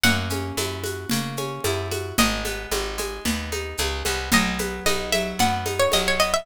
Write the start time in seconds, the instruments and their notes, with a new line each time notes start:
0.03 electric bass (finger) F#2, pizzicato strings A#3 F#5, low conga, shaker
0.30 pizzicato strings C#4, high conga, shaker
0.57 electric bass (finger) F#2, pizzicato strings E4, high conga, shaker
0.84 pizzicato strings F#4, high conga, shaker
1.09 electric bass (finger) C#3, pizzicato strings A#3, low conga, shaker
1.37 pizzicato strings C#4, high conga, shaker
1.64 electric bass (finger) F#2, pizzicato strings E4, high conga, shaker
1.91 pizzicato strings F#4, high conga, shaker
2.18 electric bass (finger) G#1, pizzicato strings G#3 D#5, low conga, shaker
2.45 pizzicato strings B3, high conga, shaker
2.71 electric bass (finger) G#1, pizzicato strings D#4, high conga, shaker
2.98 pizzicato strings G#3, high conga, shaker
3.25 electric bass (finger) D#2, pizzicato strings B3, low conga, shaker
3.52 pizzicato strings D#4, high conga, shaker
3.77 electric bass (finger) C#2, pizzicato strings G#3, high conga, shaker
4.05 electric bass (finger) C2, pizzicato strings B3, high conga, shaker
4.32 electric bass (finger) B1, pizzicato strings F#3 D#5, low conga, shaker
4.59 pizzicato strings B3, high conga, shaker
4.86 electric bass (finger) B1, pizzicato strings D#4 D#5, high conga, shaker
5.12 pizzicato strings F#3 E5, high conga, shaker
5.39 electric bass (finger) F#2, pizzicato strings B3 F#5, low conga, shaker
5.66 pizzicato strings D#4, high conga, shaker
5.79 pizzicato strings C#5
5.92 electric bass (finger) B1, pizzicato strings F#3 D#5, high conga, shaker
6.08 pizzicato strings C#5
6.19 pizzicato strings B3 D#5, shaker
6.34 pizzicato strings E5